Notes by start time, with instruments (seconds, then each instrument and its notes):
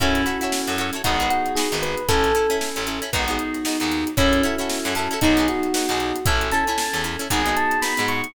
0.00 electric bass (finger) F#2, electric piano 2 C#4 E4 F#4 A4, electric piano 1 C#4, pizzicato strings E4 F#4 A4 C#5, kick, closed hi-hat
0.15 snare, closed hi-hat
0.26 pizzicato strings E4 F#4 A4 C#5, electric piano 1 F#4, closed hi-hat
0.41 pizzicato strings E4 F#4 A4 C#5, closed hi-hat
0.52 snare
0.67 electric bass (finger) F#2, pizzicato strings E4 F#4 A4 C#5, closed hi-hat
0.78 pizzicato strings E4 F#4 A4 C#5, closed hi-hat
0.93 pizzicato strings E4 F#4 A4 C#5, closed hi-hat
1.04 electric bass (finger) G#1, electric piano 2 B3 D#4 F#4 G#4, pizzicato strings D#4 F#4 G#4 B4, electric piano 1 F#4, kick, closed hi-hat
1.20 pizzicato strings D#4 F#4 G#4 B4, closed hi-hat
1.30 electric piano 1 F#4, closed hi-hat
1.46 closed hi-hat
1.55 pizzicato strings D#4 F#4 G#4 B4, electric piano 1 G#4, snare
1.72 electric bass (finger) G#1, pizzicato strings D#4 F#4 G#4 B4, closed hi-hat
1.82 electric piano 1 B4, closed hi-hat
1.97 closed hi-hat
2.09 electric bass (finger) A1, pizzicato strings C#4 E4 A4, electric piano 2 C#4 E4 A4, electric piano 1 A4, kick, closed hi-hat
2.24 snare, closed hi-hat
2.35 pizzicato strings C#4 E4 A4, closed hi-hat
2.50 pizzicato strings C#4 E4 A4, closed hi-hat
2.61 snare
2.76 electric bass (finger) A1, pizzicato strings C#4 E4 A4, closed hi-hat
2.87 pizzicato strings C#4 E4 A4, closed hi-hat
3.02 pizzicato strings C#4 E4 A4, closed hi-hat
3.13 electric bass (finger) G#1, electric piano 2 B3 D#4 F#4 G#4, pizzicato strings B3 D#4 F#4 G#4, kick, closed hi-hat
3.28 pizzicato strings B3 D#4 F#4 G#4, closed hi-hat
3.39 closed hi-hat
3.54 snare, closed hi-hat
3.65 pizzicato strings B3 D#4 F#4 G#4, snare
3.80 electric bass (finger) D#2, pizzicato strings B3 D#4 F#4 G#4, closed hi-hat
3.92 snare, closed hi-hat
4.07 closed hi-hat
4.17 electric bass (finger) F#2, pizzicato strings C#4 E4 F#4 A4, electric piano 1 C#4, electric piano 2 C#4 E4 F#4 A4, kick, closed hi-hat
4.33 closed hi-hat
4.43 pizzicato strings C#4 E4 F#4 A4, electric piano 1 E4, closed hi-hat
4.58 pizzicato strings C#4 E4 F#4 A4, closed hi-hat
4.69 snare
4.85 electric bass (finger) F#2, pizzicato strings C#4 E4 F#4 A4, closed hi-hat
4.95 pizzicato strings C#4 E4 F#4 A4, electric piano 1 A4, snare, closed hi-hat
5.11 pizzicato strings C#4 E4 F#4 A4, closed hi-hat
5.21 electric bass (finger) B1, pizzicato strings B3 D#4 F#4 G#4, electric piano 2 B3 D#4 F#4 G#4, electric piano 1 D#4, kick, closed hi-hat
5.37 pizzicato strings B3 D#4 F#4 G#4, closed hi-hat
5.48 electric piano 1 F#4, snare, closed hi-hat
5.63 closed hi-hat
5.74 pizzicato strings B3 D#4 F#4 G#4, snare
5.89 electric bass (finger) B1, pizzicato strings B3 D#4 F#4 G#4, closed hi-hat
6.00 closed hi-hat
6.16 closed hi-hat
6.26 electric bass (finger) A1, pizzicato strings C#4 E4 A4, electric piano 2 C#4 E4 A4, electric piano 1 E5, kick, closed hi-hat
6.41 closed hi-hat
6.52 pizzicato strings C#4 E4 A4, electric piano 1 A5, closed hi-hat
6.67 pizzicato strings C#4 E4 A4, closed hi-hat
6.78 snare
6.93 electric bass (finger) E2, pizzicato strings C#4 E4 A4, closed hi-hat
7.04 pizzicato strings C#4 E4 A4, snare, closed hi-hat
7.19 pizzicato strings C#4 E4 A4, closed hi-hat
7.30 electric bass (finger) G#1, pizzicato strings B3 D#4 F#4 G#4, electric piano 2 B3 D#4 F#4 G#4, electric piano 1 G#5, kick, closed hi-hat
7.46 pizzicato strings B3 D#4 F#4 G#4, closed hi-hat
7.56 electric piano 1 A5, closed hi-hat
7.71 closed hi-hat
7.82 pizzicato strings B3 D#4 F#4 G#4, electric piano 1 B5, snare
7.97 electric bass (finger) G#2, pizzicato strings B3 D#4 F#4 G#4, closed hi-hat
8.08 electric piano 1 C#6, closed hi-hat
8.24 closed hi-hat